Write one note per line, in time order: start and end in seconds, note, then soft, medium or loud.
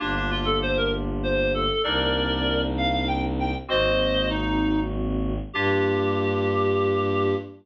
0.00 1.70 G1 medium
0.00 1.66 A#3 medium
0.00 0.15 D4 loud
0.00 1.66 D4 medium
0.00 1.66 F4 medium
0.00 1.66 G4 medium
0.16 0.30 D4 medium
0.31 0.45 F4 loud
0.45 0.59 A4 medium
0.62 0.77 C5 loud
0.77 0.92 A#4 medium
1.23 1.52 C5 medium
1.54 1.82 A4 medium
1.83 3.54 C2 loud
1.83 3.51 A#3 medium
1.83 3.51 C4 medium
1.83 3.51 D4 medium
1.83 3.51 D#4 medium
1.83 2.61 A#4 medium
1.83 2.61 D5 medium
2.78 2.92 F5 loud
2.93 3.08 F5 medium
3.07 3.22 G5 medium
3.40 3.54 G5 medium
3.68 5.39 G#1 medium
3.68 5.34 G#3 medium
3.68 5.34 A#3 medium
3.68 5.34 C4 medium
3.68 5.34 F#4 medium
3.68 4.29 C5 loud
3.68 4.29 D#5 loud
4.30 4.79 D#4 medium
5.53 7.35 G2 loud
5.53 7.35 A#3 loud
5.53 7.35 D4 loud
5.53 7.35 F4 loud
5.53 7.34 G4 loud
5.53 7.35 G4 loud